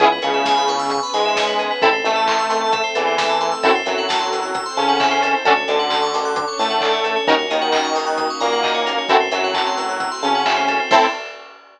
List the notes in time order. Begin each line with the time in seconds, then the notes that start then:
0.00 C#2 B3 C#4 E4 G#4, kick, closed hi-hat
0.12 B4
0.22 C#2 C#3 C#5, open hi-hat
0.34 E5
0.45 G#5, kick, snare
0.57 B5
0.68 C#6, open hi-hat
0.79 E6
0.90 B3 C#4 G#4 B4 C#6, kick, closed hi-hat
1.03 B5
1.14 G#2 G#3 G#5, open hi-hat
1.25 E5
1.36 C#5, kick, snare
1.47 B4
1.59 G#4, open hi-hat
1.71 B4
1.82 A1 C4 E4 A4, kick, closed hi-hat
1.93 C5
2.04 A1 A3 E5, open hi-hat
2.16 A5
2.27 C6, kick, clap
2.39 E6
2.50 C6, open hi-hat
2.61 A5
2.73 A3 C4 A4 E5, kick, closed hi-hat
2.84 C5
2.95 E2 E3 A4, open hi-hat
3.07 C5
3.18 E5, kick, snare
3.29 A5
3.41 C6, open hi-hat
3.52 E6
3.62 F#2 C4 E4 F#4 A4, kick, closed hi-hat
3.75 C5
3.86 F#2 F#3 E5, open hi-hat
3.98 F#5
4.09 A5, kick, snare
4.20 C6
4.32 E6, open hi-hat
4.43 F#6
4.54 C4 E4 A4 C5 E6, kick, closed hi-hat
4.66 C6
4.77 C#3 C#4 A5, open hi-hat
4.89 F#5
5.00 E5, kick, clap
5.11 C5
5.22 A4, open hi-hat
5.34 C5
5.45 D2 C#4 D4 F#4 A4, kick, closed hi-hat
5.57 C#5
5.68 D2 D3 D5, open hi-hat
5.79 F#5
5.90 A5, kick, clap
6.02 C#6
6.14 D6, open hi-hat
6.25 F#6
6.36 C#4 D4 A4 C#5 D6, kick, closed hi-hat
6.48 C#6
6.59 A2 A3 A5, open hi-hat
6.70 F#5
6.81 D5, kick, clap
6.93 C#5
7.04 A4, open hi-hat
7.16 C#5
7.27 D#2 A#3 C#4 D#4 F#4 A#4, kick, closed hi-hat
7.39 C#5
7.50 D#2 D#3 D#5, open hi-hat
7.62 F#5
7.72 A#5, kick, clap
7.84 C#6
7.95 D#6, open hi-hat
8.06 F#6
8.17 D#6, kick, closed hi-hat
8.30 C#6
8.40 A#2 A#3 A#5, open hi-hat
8.52 F#5
8.63 D#5, kick, clap
8.75 C#5
8.86 A#4, open hi-hat
8.98 C#5
9.09 F#2 A3 C4 E4 F#4 A4, kick, closed hi-hat
9.20 C5
9.31 F#2 F#3 E5, open hi-hat
9.44 F#5
9.54 A5, kick, clap
9.67 C6
9.77 E6, open hi-hat
9.89 F#6
10.00 E6, kick, closed hi-hat
10.12 C6
10.23 C#3 C#4 A5, open hi-hat
10.35 F#5
10.46 E5, kick, clap
10.57 C5
10.68 A4, open hi-hat
10.80 C5
10.91 A2 C4 E4 A4 C5 E5, kick, crash